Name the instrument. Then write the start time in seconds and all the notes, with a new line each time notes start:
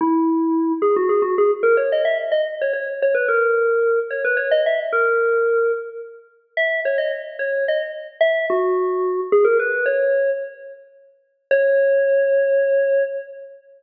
electric piano 2
0.01 E4
0.82 G#4
0.96 F#4
1.09 G#4
1.22 F#4
1.38 G#4
1.63 A#4
1.77 C#5
1.92 D#5
2.05 E5
2.32 D#5
2.62 C#5
2.73 C#5
3.02 C#5
3.14 B4
3.28 A#4
4.11 C#5
4.25 B4
4.37 C#5
4.51 D#5
4.66 E5
4.93 A#4
6.57 E5
6.85 C#5
6.98 D#5
7.39 C#5
7.68 D#5
8.21 E5
8.50 F#4
9.32 G#4
9.45 A#4
9.59 B4
9.86 C#5
11.51 C#5